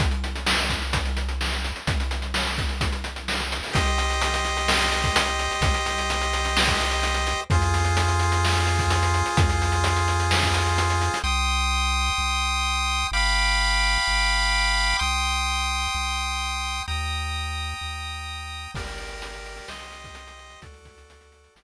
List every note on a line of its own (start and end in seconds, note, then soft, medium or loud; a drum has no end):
0.00 1.72 C2 medium
0.00 kick medium
0.00 closed hi-hat medium
0.11 closed hi-hat medium
0.24 closed hi-hat medium
0.36 closed hi-hat medium
0.46 snare loud
0.58 closed hi-hat medium
0.70 kick medium
0.70 closed hi-hat medium
0.82 closed hi-hat medium
0.93 kick medium
0.93 closed hi-hat medium
1.05 closed hi-hat medium
1.17 closed hi-hat medium
1.29 closed hi-hat medium
1.41 snare medium
1.52 closed hi-hat medium
1.65 closed hi-hat medium
1.76 closed hi-hat medium
1.87 3.60 C2 medium
1.87 kick medium
1.87 closed hi-hat medium
2.00 closed hi-hat medium
2.11 closed hi-hat medium
2.22 closed hi-hat medium
2.34 snare medium
2.46 closed hi-hat medium
2.58 kick medium
2.58 closed hi-hat medium
2.69 closed hi-hat medium
2.81 kick medium
2.81 closed hi-hat medium
2.92 closed hi-hat medium
3.04 closed hi-hat medium
3.16 closed hi-hat medium
3.28 snare medium
3.40 closed hi-hat medium
3.52 closed hi-hat medium
3.63 open hi-hat medium
3.73 5.48 C2 medium
3.73 7.41 G4 medium
3.73 7.41 C5 medium
3.73 7.41 D#5 medium
3.73 kick medium
3.73 closed hi-hat medium
3.86 closed hi-hat medium
3.98 closed hi-hat medium
4.10 closed hi-hat medium
4.21 closed hi-hat medium
4.34 closed hi-hat medium
4.45 closed hi-hat medium
4.57 closed hi-hat medium
4.68 snare loud
4.81 closed hi-hat medium
4.92 closed hi-hat medium
5.04 kick medium
5.04 closed hi-hat medium
5.16 closed hi-hat loud
5.27 closed hi-hat medium
5.39 closed hi-hat medium
5.51 closed hi-hat medium
5.61 7.34 C2 medium
5.61 kick medium
5.61 closed hi-hat medium
5.74 closed hi-hat medium
5.86 closed hi-hat medium
5.98 closed hi-hat medium
6.10 closed hi-hat medium
6.21 closed hi-hat medium
6.33 closed hi-hat medium
6.45 closed hi-hat medium
6.57 snare loud
6.67 kick medium
6.67 closed hi-hat medium
6.80 closed hi-hat medium
6.91 closed hi-hat medium
7.03 closed hi-hat medium
7.14 closed hi-hat medium
7.27 closed hi-hat medium
7.50 9.23 F2 medium
7.50 11.19 F4 medium
7.50 11.19 G#4 medium
7.50 11.19 C5 medium
7.50 kick medium
7.50 closed hi-hat medium
7.62 closed hi-hat medium
7.74 closed hi-hat medium
7.85 closed hi-hat medium
7.97 closed hi-hat medium
8.08 closed hi-hat medium
8.20 closed hi-hat medium
8.32 closed hi-hat medium
8.45 snare medium
8.55 closed hi-hat medium
8.67 closed hi-hat medium
8.79 kick medium
8.79 closed hi-hat medium
8.90 closed hi-hat medium
9.03 closed hi-hat medium
9.14 closed hi-hat medium
9.26 closed hi-hat medium
9.37 11.10 F2 medium
9.37 kick loud
9.37 closed hi-hat medium
9.50 closed hi-hat medium
9.62 closed hi-hat medium
9.72 closed hi-hat medium
9.84 closed hi-hat medium
9.96 closed hi-hat medium
10.08 closed hi-hat medium
10.20 closed hi-hat medium
10.31 snare medium
10.42 kick medium
10.42 closed hi-hat medium
10.54 closed hi-hat medium
10.67 closed hi-hat medium
10.78 closed hi-hat medium
10.90 closed hi-hat medium
11.01 closed hi-hat medium
11.14 closed hi-hat medium
11.24 12.10 C2 loud
11.24 13.07 G5 medium
11.24 13.07 C6 medium
11.24 13.07 D#6 medium
12.18 13.04 C2 medium
13.12 13.98 G1 medium
13.12 14.97 F5 medium
13.12 14.97 G5 medium
13.12 14.97 B5 medium
13.12 14.97 D6 medium
14.08 14.94 G1 medium
14.99 15.87 C2 medium
14.99 16.83 G5 medium
14.99 16.83 C6 medium
14.99 16.83 D#6 medium
15.95 16.81 C2 medium
16.88 17.74 D#2 medium
16.88 18.71 G5 medium
16.88 18.71 A#5 medium
16.88 18.71 D#6 medium
17.81 18.68 D#2 medium
18.74 19.61 G1 medium
18.74 19.68 G4 medium
18.74 19.68 A#4 medium
18.74 19.68 D5 medium
18.74 kick medium
18.74 crash medium
18.87 closed hi-hat medium
18.98 closed hi-hat medium
19.10 closed hi-hat medium
19.22 closed hi-hat loud
19.34 closed hi-hat medium
19.46 closed hi-hat medium
19.57 closed hi-hat medium
19.68 20.55 C2 medium
19.68 20.61 G4 medium
19.68 20.61 C5 medium
19.68 20.61 D#5 loud
19.68 snare loud
19.80 closed hi-hat medium
19.92 closed hi-hat medium
20.04 kick medium
20.04 closed hi-hat medium
20.15 closed hi-hat loud
20.27 closed hi-hat medium
20.39 closed hi-hat medium
20.50 closed hi-hat medium
20.62 21.48 D2 medium
20.62 21.54 F#4 medium
20.62 21.54 A4 loud
20.62 21.54 D5 medium
20.62 kick medium
20.62 closed hi-hat medium
20.74 closed hi-hat medium
20.85 kick medium
20.85 closed hi-hat medium
20.98 closed hi-hat medium
21.10 closed hi-hat medium
21.21 closed hi-hat medium
21.32 closed hi-hat medium
21.44 closed hi-hat medium
21.56 21.63 G1 medium
21.56 21.63 G4 loud
21.56 21.63 A#4 medium
21.56 21.63 D5 medium
21.56 snare loud